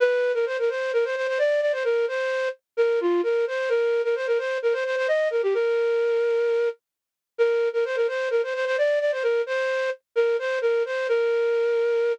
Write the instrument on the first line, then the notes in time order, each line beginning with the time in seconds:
flute
0.00 B4
0.34 A#4
0.46 C5
0.58 A#4
0.69 C5
0.93 A#4
1.04 C5
1.16 C5
1.27 C5
1.38 D5
1.61 D5
1.72 C5
1.84 A#4
2.08 C5
2.77 A#4
3.00 F4
3.23 A#4
3.47 C5
3.69 A#4
4.04 A#4
4.15 C5
4.27 A#4
4.38 C5
4.62 A#4
4.73 C5
4.85 C5
4.96 C5
5.08 D#5
5.30 A#4
5.43 G4
5.54 A#4
7.38 A#4
7.73 A#4
7.85 C5
7.96 A#4
8.08 C5
8.30 A#4
8.43 C5
8.54 C5
8.65 C5
8.78 D5
9.00 D5
9.12 C5
9.23 A#4
9.46 C5
10.15 A#4
10.39 C5
10.61 A#4
10.85 C5
11.08 A#4